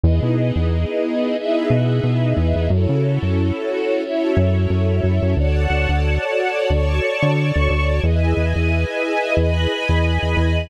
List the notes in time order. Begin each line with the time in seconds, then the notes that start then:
0.03 E2 B3 D#4 E4 G#4 B4 D#5
0.22 B2
0.56 E2
1.37 B3 D#4 E4 G#4 B4 D#5 E5
1.70 B2
2.03 B2
2.37 E2
2.56 E2
2.70 F#2 C#4 E4 F#4 A4 C#5
2.89 C#3
3.22 F#2
4.02 C#4 E4 F#4 A4 C#5 E5
4.37 F#2
4.70 F#2
5.03 F#2
5.23 F#2
5.37 D2 F#4 A4 C#5 D5 F#5 A5
5.70 D2
5.89 D2
6.70 D2 C#5 D5 A5 C#6
7.23 D3
7.56 D2
7.70 D2
8.02 E2 E4 G#4 B4 D#5 E5 G#5
8.37 E2
8.56 E2
9.37 E2 B4 D#5 G#5 B5
9.89 E2
10.23 E2
10.37 E2